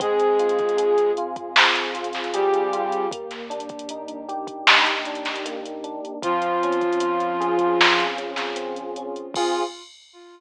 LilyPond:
<<
  \new Staff \with { instrumentName = "Flute" } { \time 4/4 \key f \minor \tempo 4 = 77 <aes aes'>4. r4. <g g'>4 | r1 | <f f'>2~ <f f'>8 r4. | f'4 r2. | }
  \new Staff \with { instrumentName = "Electric Piano 1" } { \time 4/4 \key f \minor c'8 f'8 aes'8 f'8 c'8 f'8 aes'8 f'8 | bes8 d'8 ees'8 g'8 ees'8 d'8 bes8 d'8 | c'8 des'8 f'8 aes'8 f'8 des'8 c'8 des'8 | <c' f' aes'>4 r2. | }
  \new Staff \with { instrumentName = "Synth Bass 2" } { \clef bass \time 4/4 \key f \minor f,1 | ees,1 | des,1 | f,4 r2. | }
  \new DrumStaff \with { instrumentName = "Drums" } \drummode { \time 4/4 <hh bd>16 hh16 hh32 hh32 <hh bd>32 hh32 hh16 hh16 hh16 <hh bd>16 sn16 hh16 hh32 hh32 <hh sn>32 hh32 hh16 hh16 hh16 hh16 | <hh bd>16 <hh sn>16 hh32 hh32 <hh bd>32 hh32 hh16 hh16 hh16 <hh bd>16 sn16 <hh sn>16 hh32 hh32 <hh sn>32 hh32 hh16 hh16 hh16 hh16 | <hh bd>16 hh16 hh32 hh32 <hh bd>32 hh32 hh16 hh16 hh16 <hh bd>16 sn16 hh16 hh16 <hh sn>16 hh16 hh16 hh16 hh16 | <cymc bd>4 r4 r4 r4 | }
>>